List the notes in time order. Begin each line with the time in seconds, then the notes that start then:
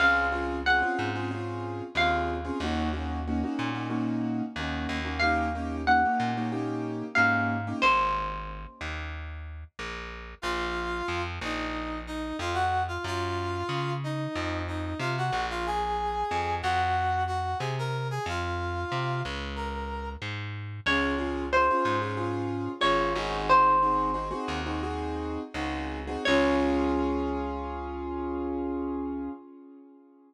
0.00 C#2 C4 C#4 F4 G#4 F5
0.32 C4 C#4 F4 G#4
0.66 C4 C#4 F4 G#4 F#5
0.82 C4 C#4 F4 G#4
0.99 G#2
1.15 C4 C#4 F4 G#4
1.31 C4 C#4 F4 G#4
1.95 D#2 C4 C#4 F4 G#4 F5
2.45 C4 C#4 F4 G#4
2.60 D#2 A#3 C#4 D#4 F#4
2.93 A#3 C#4 D#4 F#4
3.27 A#3 C#4 D#4 F#4
3.43 A#3 C#4 D#4 F#4
3.59 A#2
3.74 A#3 C#4 D#4 F#4
3.90 A#3 C#4 D#4 F#4
4.56 D#2 A#3 C#4 D#4 F#4
4.89 D#2
5.04 A#3 C#4 D#4 F#4
5.20 A#3 C#4 D#4 G4 F5
5.55 A#3 C#4 D#4 G4
5.87 A#3 C#4 D#4 G4 F#5
6.05 A#3 C#4 D#4 G4
6.20 A#2
6.37 A#3 C#4 D#4 G4
6.52 A#3 C#4 D#4 G4
7.15 G#2 A#3 C#4 D#4 G4 F5
7.67 A#3 C#4 D#4 G4
7.82 G#1 C5
8.81 D#2
9.79 A#1
10.42 A#1 F4 F5
11.08 F2
11.41 A#1 D#4 D#5
12.07 D#4 D#5
12.39 F2 F4 F5
12.54 F#4 F#5
12.88 F4 F5
13.04 F#2 F4 F5
13.69 C#3
14.04 D#4 D#5
14.35 F2
14.68 D#4 D#5
14.99 C3 F4 F5
15.18 F#4 F#5
15.32 A#1
15.50 F4 F5
15.66 G#4 G#5
16.31 F2
16.62 F2 F#4 F#5
17.27 F#4 F#5
17.59 C3 G#4 G#5
17.79 A#4 A#5
18.11 G#4 G#5
18.26 F2 F4 F5
18.92 C3
19.25 C#2
19.56 A#4 A#5
20.22 G#2
20.86 C#2 C#4 F4 G#4 C#5
21.18 C#4 F4 G#4
21.53 C#4 F4 G#4 C5
21.70 C#4 F4 G#4
21.85 G#2
22.02 C#4 F4 G#4
22.17 C#4 F4 G#4
22.81 G#1 C#4 F4 G#4 C#5
23.15 G#1 C4 D#4 F#4 G#4
23.49 C5
23.82 C4 D#4 F#4 G#4
24.14 C4 D#4 F#4 G#4
24.31 C4 D#4 F#4 G#4
24.48 D#2
24.66 C4 D#4 F#4 G#4
24.83 C4 D#4 F#4 G#4
25.54 C#2 C4 D#4 F#4 G#4
26.07 C4 D#4 F#4 G#4
26.25 C#2 C#4 F4 G#4 C#5